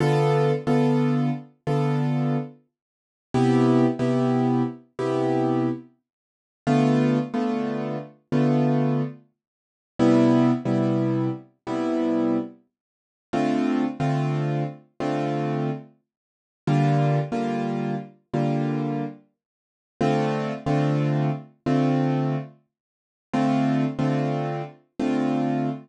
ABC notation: X:1
M:4/4
L:1/16
Q:"Swing 16ths" 1/4=72
K:Dm
V:1 name="Acoustic Grand Piano"
[D,=B,FA]3 [D,B,FA]5 [D,B,FA]8 | [C,=B,EG]3 [C,B,EG]5 [C,B,EG]8 | [D,A,=B,F]3 [D,A,B,F]5 [D,A,B,F]8 | [C,G,=B,E]3 [C,G,B,E]5 [C,G,B,E]8 |
[D,A,CF]3 [D,A,CF]5 [D,A,CF]8 | [D,G,B,F]3 [D,G,B,F]5 [D,G,B,F]8 | [D,A,CF]3 [D,A,CF]5 [D,A,CF]8 | [D,A,CF]3 [D,A,CF]5 [D,A,CF]8 |]